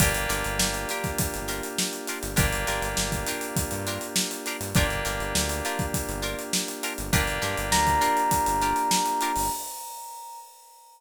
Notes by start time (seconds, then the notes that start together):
0.00 G1 A#3 D4 F4 G4 A#4, kick, closed hi-hat
0.14 closed hi-hat
0.29 G1 D4 F4 G4 A#4, snare, closed hi-hat
0.44 G1, closed hi-hat
0.59 G1, snare
0.74 closed hi-hat
0.89 D4 F4 G4 A#4, snare, closed hi-hat
1.04 kick, snare, closed hi-hat
1.18 kick, closed hi-hat
1.34 G1, snare, closed hi-hat
1.48 D4 F4 G4 A#4, closed hi-hat
1.63 closed hi-hat
1.78 snare
1.93 closed hi-hat
2.07 D4 F4 G4 A#4, closed hi-hat
2.23 G1, snare, closed hi-hat
2.36 G1 A#3 D4 F4 G4 A#4, kick, closed hi-hat
2.52 closed hi-hat
2.67 G1 D4 F4 G4 A#4, snare, closed hi-hat
2.82 G1, snare, closed hi-hat
2.97 G1, snare
3.12 kick, closed hi-hat
3.26 D4 F4 G4 A#4, closed hi-hat
3.41 closed hi-hat
3.56 kick, closed hi-hat
3.71 G2, closed hi-hat
3.87 D4 F4 G4 A#4, closed hi-hat
4.01 closed hi-hat
4.16 snare
4.31 closed hi-hat
4.46 D4 F4 G4 A#4, closed hi-hat
4.61 G2, snare, closed hi-hat
4.75 G1 A#3 D4 F4 G4 A#4, kick, closed hi-hat
4.90 closed hi-hat
5.05 G1 D4 F4 G4 A#4, snare, closed hi-hat
5.20 G1, closed hi-hat
5.35 D2, snare
5.49 closed hi-hat
5.65 D4 F4 G4 A#4, closed hi-hat
5.79 kick, closed hi-hat
5.94 kick, closed hi-hat
6.09 G1, closed hi-hat
6.22 D4 F4 G4 A#4, closed hi-hat
6.39 closed hi-hat
6.53 snare
6.68 closed hi-hat
6.83 D4 F4 G4 A#4, closed hi-hat
6.98 G1, closed hi-hat
7.13 G1 A#3 D4 F4 G4 A#4, kick, closed hi-hat
7.27 closed hi-hat
7.42 G2 D4 F4 G4 A#4, snare, closed hi-hat
7.58 G1, closed hi-hat
7.72 D2 A#5, snare
7.87 kick, closed hi-hat
8.01 D4 F4 G4 A#4, closed hi-hat
8.17 closed hi-hat
8.31 kick, closed hi-hat
8.46 G1, closed hi-hat
8.62 D4 F4 G4 A#4, snare, closed hi-hat
8.76 closed hi-hat
8.91 snare
9.05 snare, closed hi-hat
9.21 D4 F4 G4 A#4, closed hi-hat
9.36 G1, snare, open hi-hat